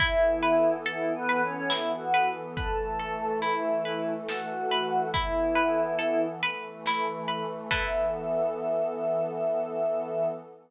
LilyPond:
<<
  \new Staff \with { instrumentName = "Choir Aahs" } { \time 3/4 \key e \mixolydian \tempo 4 = 70 <e' e''>4 \tuplet 3/2 { <e' e''>8 <b b'>8 <cis' cis''>8 } <e' e''>16 <fis' fis''>8 r16 | <a' a''>4 <e' e''>4 <fis' fis''>4 | <e' e''>4. r4. | e''2. | }
  \new Staff \with { instrumentName = "Orchestral Harp" } { \time 3/4 \key e \mixolydian e'8 b'8 a'8 b'8 e'8 b'8 | b'8 a'8 e'8 b'8 a'8 b'8 | e'8 b'8 a'8 b'8 e'8 b'8 | <e' a' b'>2. | }
  \new Staff \with { instrumentName = "Pad 2 (warm)" } { \time 3/4 \key e \mixolydian <e b a'>2. | <e a a'>2. | <e b a'>4. <e a a'>4. | <e b a'>2. | }
  \new DrumStaff \with { instrumentName = "Drums" } \drummode { \time 3/4 <hh bd>4 hh4 sn4 | <hh bd>4 hh4 sn4 | <hh bd>4 hh4 sn4 | <cymc bd>4 r4 r4 | }
>>